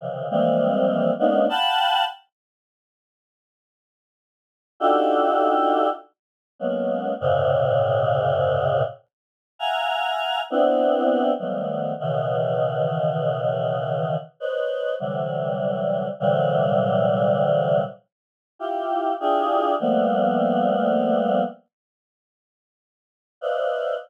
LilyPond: \new Staff { \time 4/4 \tempo 4 = 50 <c des ees e f>16 <e f g aes bes c'>8. <aes bes b des' d' ees'>16 <f'' ges'' g'' a'' b''>8 r2 r16 | <d' ees' f' ges' g' a'>4 r8 <ges aes bes b des'>8 <ges, aes, bes, c des>4. r8 | <e'' f'' ges'' aes'' bes''>8. <b c' d' e'>8. <ees f ges g a b>8 <b, des ees e>2 | <b' c'' des'' ees''>8 <c d e ges g>4 <bes, c d e ges g>4. r8 <e' f' g'>8 |
<d' e' f' g' aes'>8 <f g a bes b>4. r4. <b' c'' d'' ees'' e'' f''>8 | }